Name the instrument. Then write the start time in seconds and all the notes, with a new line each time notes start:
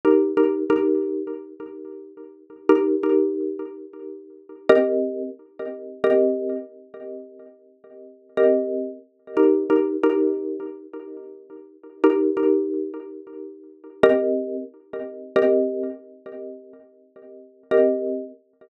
xylophone
0.05 D#4 G4 A#4
0.37 D#4 G4 A#4
0.70 D#4 G4 A#4
2.69 D#4 G4 A#4
3.03 D#4 G4 A#4
4.69 C4 G4 A#4 D#5
6.04 C4 G4 A#4 D#5
8.37 C4 G4 A#4 D#5
9.37 D#4 G4 A#4
9.70 D#4 G4 A#4
10.03 D#4 G4 A#4
12.04 D#4 G4 A#4
12.37 D#4 G4 A#4
14.03 C4 G4 A#4 D#5
15.36 C4 G4 A#4 D#5
17.71 C4 G4 A#4 D#5